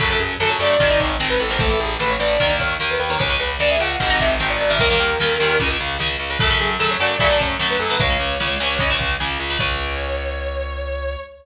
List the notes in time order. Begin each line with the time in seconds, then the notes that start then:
0.00 F#2 C#3 F#3 A3 A4, kick, closed hi-hat
0.10 C#3 F#3 A3
0.19 F#2 G#4, closed hi-hat
0.40 F#2 C#3 F#3 A3 A4, snare
0.50 C#5
0.59 F#2 C#3 F#3 A3 D5, closed hi-hat
0.79 G#1 C3 D#3 G#3, kick, closed hi-hat
0.90 C3 D#3 G#3
1.00 G#1 C#5, kick, closed hi-hat
1.20 G#1 C3 D#3 G#3, snare
1.30 B4
1.40 A1 A4, closed hi-hat
1.50 C3 D#3 G#3 C5
1.59 E3 A3 A4, kick, closed hi-hat
1.70 E3 A3
1.80 A1 G#4, closed hi-hat
1.99 A1 E3 A3 B4, snare
2.10 C#5
2.19 A1 E3 A3 D5, closed hi-hat
2.39 D#2 D#3 A#3, kick, closed hi-hat
2.50 D#3 A#3
2.59 D#2 C#5, kick, closed hi-hat
2.80 D#2 D#3 A#3, snare
2.91 B4
3.00 D#2 B4, closed hi-hat
3.10 D#3 A#3 C#5
3.19 C#2 C#3 G#3 C#5, kick, closed hi-hat
3.30 C#3 G#3
3.40 C#2 B4, closed hi-hat
3.59 C#2 C#3 G#3 D5, snare
3.70 E5
3.79 C#2 C#3 G#3 F#5, closed hi-hat
4.00 G#1 C3 D#3 G#3, kick, closed hi-hat
4.10 C3 D#3 G#3
4.20 G#1 E5, kick, closed hi-hat
4.39 G#1 C3 D#3 G#3, snare
4.50 D5
4.59 G#1 D5, open hi-hat
4.70 C3 D#3 G#3 E5
4.79 D#2 A#2 D#3 G3 A#4, kick, closed hi-hat
4.90 A#2 D#3 G3
5.00 D#2, closed hi-hat
5.20 D#2 A#2 D#3 G3, snare
5.40 D#2 A#2 D#3 G3, closed hi-hat
5.60 C#2 C#3 G#3, kick, closed hi-hat
5.70 C#3 G#3
5.80 C#2, closed hi-hat
5.99 C#2 C#3 G#3, snare
6.20 C#2, open hi-hat
6.30 C#3 G#3
6.39 F#2 C#3 F#3 A3 A4, kick, closed hi-hat
6.50 C#3 F#3 A3
6.60 F#2 G#4, closed hi-hat
6.79 F#2 C#3 F#3 A3 A4, snare
6.91 C#5
7.00 F#2 C#3 F#3 A3 D5, closed hi-hat
7.20 F#2 C#3 F#3 A3, kick, closed hi-hat
7.30 C#3 F#3 A3
7.40 F#2 C#5, kick, closed hi-hat
7.59 F#2 C#3 F#3 A3, snare
7.70 B4
7.79 F#2 A4, closed hi-hat
7.90 C#3 F#3 A3 B4
7.99 C#2 C#3 G#3 C#5, kick, closed hi-hat
8.10 C#3 G#3
8.20 C#2, closed hi-hat
8.40 C#2 C#3 G#3, snare
8.60 C#2 C#3 G#3, closed hi-hat
8.79 C#2 C#3 G#3, kick, closed hi-hat
8.90 C#3 G#3
8.99 C#2, kick, closed hi-hat
9.20 C#2 C#3 G#3, snare
9.40 C#2, closed hi-hat
9.50 C#3 G#3
9.59 C#2 C#3 G#3 C#5, kick, crash